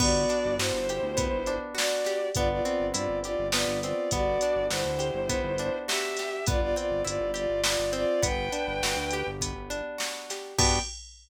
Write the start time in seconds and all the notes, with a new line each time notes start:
0.00 G1 B3 F#4 D5, kick, crash
0.29 D4, closed hi-hat
0.45 G1
0.58 G2 E4 F#4 C5, snare
0.73 G1
0.89 G4, closed hi-hat
1.03 D2
1.17 B3, kick, closed hi-hat
1.32 G1
1.46 D4, closed hi-hat
1.75 F#4 D5, snare
2.05 G4, snare, closed hi-hat
2.34 G1 B3 F4 D5, kick, closed hi-hat
2.50 F4 D5
2.63 C4 F4 D5, closed hi-hat
2.80 G1
2.94 G2 E4 F4 D5, closed hi-hat
3.09 G1
3.24 F4 G4 D5, closed hi-hat
3.39 G1
3.52 B3 F4 D5, snare
3.67 G1
3.83 C4 F4 D5, closed hi-hat
4.11 G1 B3 F#4 D5, kick, closed hi-hat
4.41 D4, closed hi-hat
4.56 G1
4.70 G1 E4 F#4 C5, snare
4.85 D2
4.99 G4, closed hi-hat
5.14 G1
5.29 B3, kick, closed hi-hat
5.44 G1
5.58 D4, closed hi-hat
5.87 F#4 G4 E5, snare
6.17 G4, snare, closed hi-hat
6.46 G1 B3 F4 D5, kick, closed hi-hat
6.61 F4 D5
6.76 C4 F4 D5, closed hi-hat
6.90 G1
7.05 G1 E4 F4 D5, closed hi-hat
7.21 G1
7.34 F4 G4 D5, closed hi-hat
7.50 G1
7.64 B3 F4 D5, snare
7.79 G1
7.93 C4 F4 D5, closed hi-hat
8.22 G1 B3 B4 G5, kick, closed hi-hat
8.52 D4, closed hi-hat
8.67 G1
8.82 G1 F#4, snare
8.96 D2
9.11 G4, closed hi-hat
9.27 G1
9.41 B3, kick, closed hi-hat
9.56 G1
9.70 D4, closed hi-hat
9.98 F#4, snare
10.30 G4, snare, closed hi-hat
10.58 G2 B3 D4 F#4 G4 G5, kick, crash